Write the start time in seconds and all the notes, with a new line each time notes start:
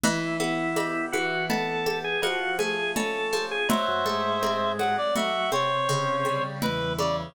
0.04 E3 E4, cowbell, low conga
0.40 B3 E4, high conga
0.76 G4, cowbell, high conga
1.12 E3 F#4, high conga
1.50 B3 A4, cowbell, low conga
1.86 G4, high conga
2.04 G#4
2.22 F3 F#4, cowbell, high conga
2.59 A3 G#4, high conga
2.96 C#4 A4, cowbell, low conga
3.33 F3, high conga
3.51 G#4
3.69 F#3 C5 E5, cowbell, low conga
3.88 F#2 F#3
4.05 G#2 G#3 A3, high conga
4.43 C4, cowbell, high conga
4.79 F#3 F#5, high conga
4.97 D5
5.16 F#3 A3 F#4 E5, cowbell, low conga
5.52 C3 C4 C#5, high conga
5.89 C#3, cowbell, high conga
6.25 G3, high conga
6.62 E2 E3 E4 B4, cowbell, low conga
6.98 C#3 D5, high conga